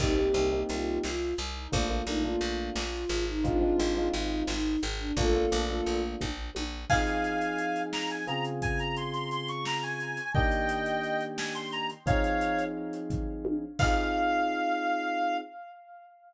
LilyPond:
<<
  \new Staff \with { instrumentName = "Ocarina" } { \time 5/8 \key c \minor \tempo 4 = 87 <ees' g'>4 f'8 f'8 r16 ees'16 | f'8 ees'16 f'16 f'8 f'8. ees'16 | <d' f'>4 ees'8 ees'8 r16 d'16 | <f' a'>4. r4 |
\key f \minor r2 r8 | r2 r8 | r2 r8 | r2 r8 |
r2 r8 | }
  \new Staff \with { instrumentName = "Clarinet" } { \time 5/8 \key c \minor r2 r8 | r2 r8 | r2 r8 | r2 r8 |
\key f \minor <f'' aes''>4. bes''16 aes''16 bes''16 r16 | aes''16 bes''16 c'''16 c'''16 c'''16 des'''16 bes''16 aes''8. | <ees'' g''>4. aes''16 c'''16 bes''16 r16 | <des'' f''>4 r4. |
f''2~ f''8 | }
  \new Staff \with { instrumentName = "Electric Piano 1" } { \time 5/8 \key c \minor <bes c' ees' g'>16 <bes c' ees' g'>16 <bes c' ees' g'>16 <bes c' ees' g'>4.~ <bes c' ees' g'>16 | <a bes d' f'>16 <a bes d' f'>16 <a bes d' f'>16 <a bes d' f'>4.~ <a bes d' f'>16 | <aes c' ees' f'>16 <aes c' ees' f'>16 <aes c' ees' f'>16 <aes c' ees' f'>4.~ <aes c' ees' f'>16 | <a bes d' f'>16 <a bes d' f'>16 <a bes d' f'>16 <a bes d' f'>4.~ <a bes d' f'>16 |
\key f \minor <f c' ees' aes'>2 <des c' f' aes'>8~ | <des c' f' aes'>2~ <des c' f' aes'>8 | <ees bes d' g'>2~ <ees bes d' g'>8 | <f c' ees' aes'>2~ <f c' ees' aes'>8 |
<c' ees' f' aes'>2~ <c' ees' f' aes'>8 | }
  \new Staff \with { instrumentName = "Electric Bass (finger)" } { \clef bass \time 5/8 \key c \minor c,8 c,8 c,8 c,8 c,8 | bes,,8 bes,,8 bes,,8 bes,,8 aes,,8~ | aes,,8 aes,,8 aes,,8 aes,,8 aes,,8 | bes,,8 bes,,8 bes,,8 bes,,8 bes,,8 |
\key f \minor r2 r8 | r2 r8 | r2 r8 | r2 r8 |
r2 r8 | }
  \new DrumStaff \with { instrumentName = "Drums" } \drummode { \time 5/8 <cymc bd>8 hh8 hh8 sn8 hh8 | <hh bd>8 hh8 hh8 sn8 hho8 | <hh bd>8 hh8 hh8 sn8 hh8 | <hh bd>8 hh8 hh8 <bd tommh>8 tommh8 |
<cymc bd>16 hh16 hh16 hh16 hh16 hh16 sn16 hh16 hh16 hh16 | <hh bd>16 hh16 hh16 hh16 hh16 hh16 sn16 hh16 hh16 hh16 | bd16 hh16 hh16 hh16 hh16 hh16 sn16 hh16 hh16 hh16 | <hh bd>16 hh16 hh16 hh8 hh16 <hh bd tomfh>8 tommh8 |
<cymc bd>4. r4 | }
>>